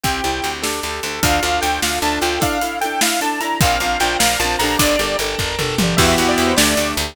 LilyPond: <<
  \new Staff \with { instrumentName = "Lead 2 (sawtooth)" } { \time 6/8 \key e \minor \tempo 4. = 101 g''4. r4. | \key d \minor f''4 g''8 f''8 a''8 g''8 | f''4 g''8 f''8 a''8 bes''8 | f''4 g''8 f''8 a''8 bes''8 |
d''4 r2 | \key e \minor e''16 e''16 fis''16 d''16 r16 c''16 d''4 r8 | }
  \new Staff \with { instrumentName = "Acoustic Grand Piano" } { \time 6/8 \key e \minor c'8 e'8 g'8 d'8 g'8 a'8 | \key d \minor d'8 f'8 a'8 f'8 d'8 f'8 | d'8 e'8 a'8 e'8 d'8 e'8 | c'8 d'8 f'8 bes'8 f'8 d'8 |
d'8 g'8 a'8 bes'8 a'8 g'8 | \key e \minor <b e' fis' g'>4. a8 d'8 g'8 | }
  \new Staff \with { instrumentName = "Acoustic Guitar (steel)" } { \time 6/8 \key e \minor <c' e' g'>8 <c' e' g'>8 <c' e' g'>8 <d' g' a'>8 <d' g' a'>8 <d' g' a'>8 | \key d \minor <d' f' a'>8 <d' f' a'>8 <d' f' a'>4 <d' f' a'>8 <d' f' a'>8 | <d' e' a'>8 <d' e' a'>8 <d' e' a'>4 <d' e' a'>8 <d' e' a'>8 | <c' d' f' bes'>8 <c' d' f' bes'>8 <c' d' f' bes'>4 <c' d' f' bes'>8 <d' g' a' bes'>8~ |
<d' g' a' bes'>8 <d' g' a' bes'>8 <d' g' a' bes'>4 <d' g' a' bes'>8 <d' g' a' bes'>8 | \key e \minor <b e' fis' g'>8 <b e' fis' g'>8 <b e' fis' g'>8 <a d' g'>8 <a d' g'>8 <a d' g'>8 | }
  \new Staff \with { instrumentName = "Electric Bass (finger)" } { \clef bass \time 6/8 \key e \minor c,8 c,8 d,4 d,8 d,8 | \key d \minor d,8 d,8 d,8 d,8 d,8 d,8 | r2. | bes,,8 bes,,8 bes,,8 bes,,8 bes,,8 bes,,8 |
g,,8 g,,8 g,,8 g,,8 g,,8 g,,8 | \key e \minor e,8 e,8 e,8 d,8 d,8 d,8 | }
  \new Staff \with { instrumentName = "Drawbar Organ" } { \time 6/8 \key e \minor <c' e' g'>4. <d' g' a'>4. | \key d \minor <d' f' a'>2. | r2. | <c'' d'' f'' bes''>2. |
<d'' g'' a'' bes''>2. | \key e \minor <b e' fis' g'>4. <a d' g'>4. | }
  \new DrumStaff \with { instrumentName = "Drums" } \drummode { \time 6/8 <hh bd>8 hh8 hh8 sn8 hh8 hh8 | <hh bd>8 hh8 hh8 sn8 hh8 hh8 | <hh bd>8 hh8 hh8 sn8 hh8 hh8 | <hh bd>8 hh8 hh8 sn8 hh8 hho8 |
<hh bd>8 hh8 hh8 <bd tomfh>8 toml8 tommh8 | <cymc bd>8 hh8 hh8 sn8 hh8 hh8 | }
>>